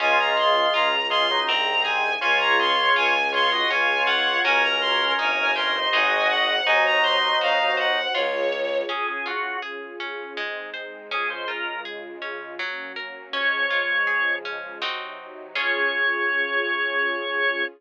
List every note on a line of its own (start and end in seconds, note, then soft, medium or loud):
0.00 0.67 C#2 loud
0.00 0.95 G#3 medium
0.00 0.33 C#4 loud
0.00 1.46 C#4 medium
0.00 0.95 F4 loud
0.00 1.46 F4 medium
0.00 1.46 G#4 medium
0.00 0.18 G#5 loud
0.19 0.36 A#5 medium
0.37 0.70 G#4 medium
0.37 0.73 C6 medium
0.73 1.41 C#2 medium
0.73 1.07 F4 medium
0.73 1.07 A#5 loud
1.10 1.27 G#3 medium
1.10 1.27 F4 medium
1.10 1.44 G#4 medium
1.10 1.40 C6 loud
1.31 1.48 F#3 medium
1.31 1.48 D#4 medium
1.47 2.16 C2 loud
1.47 2.10 D#3 medium
1.47 2.20 C4 medium
1.47 1.82 C4 loud
1.47 2.10 C4 medium
1.47 2.20 D#4 medium
1.47 2.20 G#4 medium
1.47 1.83 A#5 loud
1.83 2.18 G#4 medium
1.83 2.13 G#5 loud
2.21 2.89 C#2 loud
2.21 2.55 C#4 loud
2.21 3.69 C#4 medium
2.21 3.14 F4 medium
2.21 3.69 F4 medium
2.21 3.69 G#4 medium
2.21 3.14 C#5 loud
2.21 2.39 G#5 loud
2.40 2.57 A#5 loud
2.60 2.93 G#4 medium
2.60 2.91 C6 loud
2.96 3.63 C#2 loud
2.96 3.29 F4 medium
2.96 3.28 G#5 loud
3.32 3.50 F4 medium
3.32 3.67 G#4 medium
3.32 3.50 C#5 medium
3.32 3.67 C6 loud
3.52 3.69 F#4 medium
3.52 3.69 D#5 medium
3.70 4.38 C#2 medium
3.70 4.04 C#4 loud
3.70 4.44 C#4 medium
3.70 4.44 F4 medium
3.70 4.43 F4 medium
3.70 4.44 G#4 medium
3.70 4.43 C#5 medium
3.70 4.05 G#5 medium
4.06 4.40 F4 medium
4.06 4.38 F#5 loud
4.44 5.13 C#2 loud
4.44 5.51 C#4 medium
4.44 5.17 C#4 medium
4.44 5.11 C#4 loud
4.44 5.17 F#4 medium
4.44 5.11 F#4 loud
4.44 5.51 A#4 medium
4.44 5.17 A#4 medium
4.44 5.11 A#4 medium
4.44 4.62 G#5 loud
4.63 4.80 A#5 loud
4.81 5.13 C6 loud
5.18 5.87 G1 loud
5.18 5.52 D#4 medium
5.18 5.92 D#4 medium
5.18 5.93 G4 medium
5.18 5.93 A#4 medium
5.18 5.53 G#5 loud
5.55 5.75 C#4 medium
5.55 5.89 G4 medium
5.55 5.75 A#4 medium
5.55 5.91 C6 medium
5.76 5.93 D#4 medium
5.76 5.93 C5 medium
5.92 6.60 G#1 loud
5.92 6.66 D#4 medium
5.92 6.60 D#4 loud
5.92 6.54 F#4 medium
5.92 6.66 G#4 medium
5.92 6.60 G#4 loud
5.92 6.66 C5 medium
5.92 6.60 C5 medium
5.92 6.54 D#5 medium
5.92 6.29 G#5 medium
6.29 6.64 F#5 loud
6.66 7.33 D#2 medium
6.66 7.98 F#3 medium
6.66 7.00 D#4 loud
6.66 7.98 D#4 loud
6.66 8.14 D#4 medium
6.66 8.14 F#4 medium
6.66 8.14 C5 medium
6.66 6.84 G#5 loud
6.86 7.03 A#5 loud
7.03 7.37 C5 medium
7.03 7.38 C6 loud
7.41 8.07 D#2 medium
7.41 7.75 F#4 medium
7.41 7.74 F5 loud
7.77 8.10 C5 medium
7.77 8.13 F#5 medium
8.15 8.83 C#2 loud
8.15 8.48 F4 loud
8.15 8.89 F4 medium
8.15 8.89 G#4 medium
8.15 8.78 C#5 loud
8.15 8.89 C#5 medium
8.52 8.86 C#5 medium
8.89 9.22 C#4 medium
8.89 10.37 C#4 medium
8.89 10.37 F4 medium
8.89 9.07 G#4 medium
8.89 10.37 G#4 medium
9.08 9.26 G#4 medium
9.26 9.59 F4 medium
9.26 9.57 F#4 medium
9.62 9.96 G#4 medium
10.00 10.33 C#4 medium
10.36 11.09 G#3 medium
10.36 10.70 G#3 medium
10.36 11.09 C4 medium
10.36 11.09 D#4 medium
10.74 11.07 C5 medium
11.10 12.57 C#3 medium
11.10 12.57 G#3 medium
11.10 11.45 C#4 medium
11.10 12.57 F4 medium
11.10 11.30 G#4 loud
11.30 11.48 C5 medium
11.48 11.81 F4 medium
11.48 11.80 A#4 medium
11.85 12.19 G#4 medium
12.22 12.55 C#4 medium
12.59 12.93 F#3 loud
12.59 13.34 F#3 medium
12.59 13.34 A#3 medium
12.59 13.34 C#4 medium
12.96 13.29 A#4 medium
13.33 14.80 C#3 medium
13.33 14.80 F3 medium
13.33 14.80 G#3 medium
13.33 13.67 C#4 loud
13.33 14.33 C#5 loud
13.70 14.04 F4 medium
14.07 14.40 G#4 medium
14.45 14.78 C#4 medium
14.82 15.55 C3 medium
14.82 15.55 F#3 medium
14.82 15.48 C4 loud
14.82 15.48 D#4 medium
14.82 15.55 D#4 medium
14.82 15.48 F#4 medium
15.55 17.62 C#4 medium
15.55 17.62 C#4 loud
15.55 17.62 F4 loud
15.55 17.62 F4 medium
15.55 17.62 G#4 loud
15.55 17.62 G#4 medium
15.55 17.62 C#5 loud